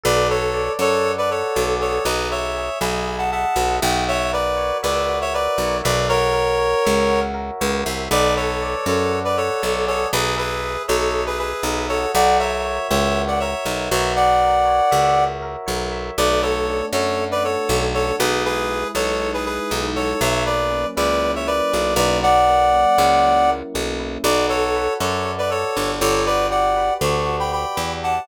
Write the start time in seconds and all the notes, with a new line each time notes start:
0.03 B1 A4 B4 D5
0.30 A4 B4 C#5
0.54 D5
0.79 F#2 A4 C#5 F#5
1.05 A4
1.18 B4 D5
1.31 A4 B4 C#5
1.55 B1 D5
1.80 G#4 A4 C#5
2.05 B1 B4 D#5
2.31 C#5 E5
2.57 G#4
2.81 B1 D#5 G#5 B5
3.08 G#4
3.18 F#5 A5
3.32 E5 F#5 A5
3.56 B1 D#5
3.82 B1 F#4 G5
4.08 C#5 E5
4.33 A#4 B4 D5
4.57 C#5
4.83 C#2 B4 D5 E5
5.09 F#4
5.21 C#5 E5
5.34 A#4 B4 D5
5.58 B1 C#5
5.84 B1 B4 D5 E5
6.09 F#4 A#4 C#5
6.33 A#4
6.59 C#5
6.85 C#2 E5
7.09 F#4
7.34 A#4
7.61 C#2 C#5
7.85 C2 E5
8.11 B1 A4 B4 D5
8.36 A4 B4 C#5
8.62 D5
8.86 F#2 A4 C#5 F#5
9.12 A4
9.25 B4 D5
9.37 A4 B4 C#5
9.62 B1 D5
9.87 G#4 A4 C#5
10.13 B1 G#4 B4
10.37 G#4 B4 E5
10.64 G#4
10.88 B1 A4 C#5 D#5
11.15 G#4
11.26 G#4 B4
11.38 G#4 B4 E5
11.63 B1 D#5
11.89 F#4 A4 C#5
12.14 B1 D5 F#5
12.39 A#4 C#5 E5
12.65 C#5
12.89 C#2 C#5 E5
13.15 F#4
13.28 D5 F#5
13.40 A#4 C#5 E5
13.65 B1 C#5
13.91 B1 F#4 C#5 E5
14.16 D5 F#5
14.42 A#4
14.65 C#5
14.91 C#2 E5
15.16 F#4
15.42 A#4
15.66 B1 C#5
15.92 E5
16.17 B1 A3 B4 D5
16.42 B3 A4 C#5
16.68 D4
16.93 F#2 F#4 A4 C#5
17.18 A3
17.31 B4 D5
17.43 B3 A4 C#5
17.68 B1 D4
17.94 F#4 A4 C#5
18.19 B1 G#3 G#4 B4
18.45 E4 G#4 B4
18.69 G#3
18.95 B1 D#4 A4 C#5
19.20 G#3
19.34 G#4 B4
19.45 E4 G#4 B4
19.71 B1 D#4
19.96 F#3 A4 C#5
20.21 B1 C#5 E5
20.46 A#3 B4 D5
20.70 C#4
20.96 C#2 E4 B4 D5
21.22 F#3
21.35 C#5 E5
21.47 A#3 B4 D5
21.72 B1 C#4
21.96 B1 E4 B4 D5
22.23 F#3 D5 F#5
22.47 A#3
22.74 C#4
22.98 C#2 E4
23.25 F#3
23.49 A#3
23.74 B1 C#4
23.99 E4
24.24 B1 F#4 B4 D5
24.49 A4 C#5
24.76 B4
25.00 F#2 A4 C#5 D5
25.25 F#4
25.38 B4 D5
25.50 A4 C#5
25.76 G1 B4
26.01 G1 A4 C#5 D5
26.26 F#4 B4 D5
26.51 G4 D5 F#5
26.77 B4
27.01 D2 D5 A5 C#6
27.26 F#4
27.39 G5 B5
27.52 G4 G5 B5
27.76 E2 B4
28.03 D5 F#5 A5